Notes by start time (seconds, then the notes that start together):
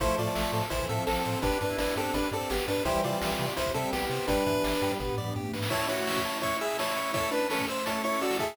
0.00 A1 F3 A3 C4 E4 A4 C5, kick, closed hi-hat
0.09 closed hi-hat
0.18 A2 F4 C5 D5, closed hi-hat
0.27 closed hi-hat
0.35 A1 E5, snare
0.45 closed hi-hat
0.53 A2 A4, closed hi-hat
0.63 closed hi-hat
0.70 A1 E3 E4 C5, kick, closed hi-hat
0.80 kick, closed hi-hat
0.89 A2 F3 C4 A4 E5, closed hi-hat
0.98 closed hi-hat
1.07 A1 C4 A4, snare
1.16 closed hi-hat
1.25 A2 C5, closed hi-hat
1.34 closed hi-hat
1.42 G1 B3 D4 G4 B4, kick, closed hi-hat
1.52 closed hi-hat
1.61 G2 D4 B4, kick, closed hi-hat
1.70 E4, closed hi-hat
1.78 G1 D4 B4 D5, snare
1.88 closed hi-hat
1.96 G2 C4 D4 G4 A4, closed hi-hat
2.05 closed hi-hat
2.14 G1 D4 B4, kick, closed hi-hat
2.23 closed hi-hat
2.31 G2 C4 A4 D5, closed hi-hat
2.41 closed hi-hat
2.50 G1 B3 G4, snare
2.59 closed hi-hat
2.68 G2 D4 B4, closed hi-hat
2.77 closed hi-hat
2.85 C2 E3 G3 C4 E4 G4 C5, kick, closed hi-hat
2.94 closed hi-hat
3.04 C3 F4 C5 D5, closed hi-hat
3.13 closed hi-hat
3.21 C2 E5, snare
3.30 closed hi-hat
3.39 C3 G4, closed hi-hat
3.48 closed hi-hat
3.57 C2 E4 C5, kick, closed hi-hat
3.66 kick, closed hi-hat
3.74 C3 G3 C4 A4 E5, closed hi-hat
3.84 closed hi-hat
3.93 C2 B3 G4, snare
4.02 closed hi-hat
4.10 C3 C5, closed hi-hat
4.20 open hi-hat
4.28 G1 G3 B3 D4 G4 B4, kick, closed hi-hat
4.38 closed hi-hat
4.46 G2 E3 B4, kick, closed hi-hat
4.64 G1 D5, snare
4.73 closed hi-hat
4.82 G2 G3 G4, closed hi-hat
4.91 closed hi-hat
4.99 G1 B3 B4, kick, floor tom
5.09 floor tom
5.18 G2 D5, mid tom
5.27 mid tom
5.36 G2 G4, high tom
5.45 high tom
5.53 G#2 B4, snare
5.63 snare
5.70 A3 C#4 E4 C#5 A5, kick, crash
5.80 closed hi-hat
5.88 E4 F#4 C#5 C#6, closed hi-hat
5.98 closed hi-hat
6.07 E6, snare
6.16 kick, closed hi-hat
6.25 A5, closed hi-hat
6.34 closed hi-hat
6.42 E4 C#5 C#6, kick, closed hi-hat
6.51 closed hi-hat
6.61 G#4 E5 E6, closed hi-hat
6.70 closed hi-hat
6.78 E4 C#5 A5, snare
6.88 closed hi-hat
6.96 C#6, closed hi-hat
7.06 closed hi-hat
7.14 E4 A4 C#5 E6, kick, closed hi-hat
7.23 closed hi-hat
7.31 D4 B4 A5, closed hi-hat
7.41 closed hi-hat
7.50 C#4 A4 C#6, snare
7.59 kick, closed hi-hat
7.68 C5 E6, closed hi-hat
7.77 closed hi-hat
7.86 E4 A4 C#5 A5, kick, closed hi-hat
8.03 E4 C#5 C#6, closed hi-hat
8.13 closed hi-hat
8.21 F#4 D5 E6, closed hi-hat
8.31 snare
8.39 G#4 E5 A5, kick, closed hi-hat
8.48 closed hi-hat